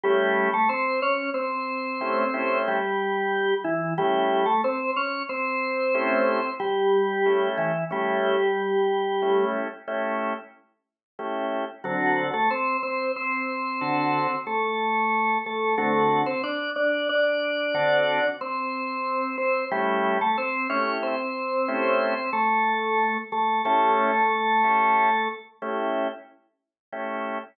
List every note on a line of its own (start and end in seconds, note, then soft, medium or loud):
0.04 0.49 G3 medium
0.04 0.50 A3 loud
0.04 0.50 C#4 loud
0.04 0.50 E4 medium
0.04 0.49 G4 medium
0.04 0.50 G4 loud
0.53 0.69 A3 medium
0.53 0.69 A4 medium
0.69 1.00 C4 medium
0.69 1.00 C5 medium
1.02 1.30 C#4 medium
1.02 1.30 C#5 medium
1.34 2.58 C4 medium
1.34 2.58 C5 medium
2.01 2.24 A3 medium
2.01 2.24 C#4 medium
2.01 2.24 E4 loud
2.01 2.24 G4 medium
2.34 2.80 A3 medium
2.34 2.80 C#4 medium
2.34 2.80 E4 medium
2.34 2.80 G4 medium
2.68 3.54 G3 medium
2.68 3.54 G4 medium
3.64 3.94 E3 medium
3.64 3.94 E4 medium
3.98 4.46 G3 medium
3.98 4.44 A3 loud
3.98 4.44 C#4 medium
3.98 4.44 E4 loud
3.98 4.46 G4 medium
4.46 4.61 A3 medium
4.46 4.61 A4 medium
4.64 4.91 C4 medium
4.64 4.91 C5 medium
4.96 5.23 C#4 medium
4.96 5.23 C#5 medium
5.29 6.50 C4 medium
5.29 6.50 C5 medium
5.94 6.40 A3 loud
5.94 6.40 C#4 loud
5.94 6.40 E4 loud
5.94 6.40 G4 loud
6.60 7.49 G3 medium
6.60 7.49 G4 medium
7.26 7.72 A3 medium
7.26 7.72 C#4 medium
7.26 7.72 E4 medium
7.26 7.72 G4 medium
7.58 7.84 E3 medium
7.58 7.84 E4 medium
7.91 9.45 G3 medium
7.91 8.36 A3 medium
7.91 8.36 C#4 medium
7.91 8.36 E4 medium
7.91 9.45 G4 medium
9.22 9.68 A3 medium
9.22 9.68 C#4 medium
9.22 9.68 E4 medium
9.22 9.68 G4 medium
9.88 10.33 A3 loud
9.88 10.33 C#4 medium
9.88 10.33 E4 loud
9.88 10.33 G4 medium
11.19 11.65 A3 medium
11.19 11.65 C#4 medium
11.19 11.65 E4 medium
11.19 11.65 G4 medium
11.84 12.31 D3 loud
11.84 12.23 F#3 medium
11.84 12.31 C4 medium
11.84 12.23 F#4 medium
11.84 12.31 F#4 medium
11.84 12.31 A4 loud
12.34 12.49 A3 medium
12.34 12.49 A4 medium
12.51 12.77 C4 medium
12.51 12.77 C5 medium
12.83 13.12 C4 medium
12.83 13.12 C5 medium
13.16 14.35 C4 medium
13.16 14.35 C5 medium
13.81 14.27 D3 loud
13.81 14.27 C4 medium
13.81 14.27 F#4 loud
13.81 14.27 A4 medium
14.47 15.38 A3 medium
14.47 15.38 A4 medium
15.46 15.75 A3 medium
15.46 15.75 A4 medium
15.78 16.24 D3 loud
15.78 16.21 A3 medium
15.78 16.24 C4 medium
15.78 16.24 F#4 loud
15.78 16.21 A4 medium
16.26 16.42 C4 medium
16.26 16.42 C5 medium
16.44 16.70 D4 medium
16.44 16.70 D5 medium
16.76 17.08 D4 medium
16.76 17.08 D5 medium
17.09 18.27 D4 medium
17.09 18.27 D5 medium
17.74 18.20 D3 loud
17.74 18.20 C4 loud
17.74 18.20 F#4 loud
17.74 18.20 A4 loud
18.41 19.36 C4 medium
18.41 19.36 C5 medium
19.38 19.65 C4 medium
19.38 19.65 C5 medium
19.71 20.19 G3 medium
19.71 20.17 A3 loud
19.71 20.17 C#4 loud
19.71 20.17 E4 loud
19.71 20.19 G4 medium
20.21 20.37 A3 medium
20.21 20.37 A4 medium
20.38 20.67 C4 medium
20.38 20.67 C5 medium
20.70 21.15 A3 medium
20.70 20.97 C#4 medium
20.70 21.15 E4 medium
20.70 21.15 G4 medium
20.70 20.97 C#5 medium
21.03 22.30 C4 medium
21.03 22.30 C5 medium
21.68 22.14 A3 loud
21.68 22.14 C#4 loud
21.68 22.14 E4 medium
21.68 22.14 G4 loud
22.33 23.17 A3 medium
22.33 23.17 A4 medium
23.32 23.62 A3 medium
23.32 23.62 A4 medium
23.65 25.28 A3 medium
23.65 24.11 C#4 loud
23.65 24.11 E4 loud
23.65 24.11 G4 medium
23.65 25.28 A4 medium
24.64 25.10 A3 medium
24.64 25.10 C#4 medium
24.64 25.10 E4 medium
24.64 25.10 G4 medium
25.62 26.08 A3 loud
25.62 26.08 C#4 medium
25.62 26.08 E4 loud
25.62 26.08 G4 loud
26.92 27.38 A3 medium
26.92 27.38 C#4 medium
26.92 27.38 E4 medium
26.92 27.38 G4 medium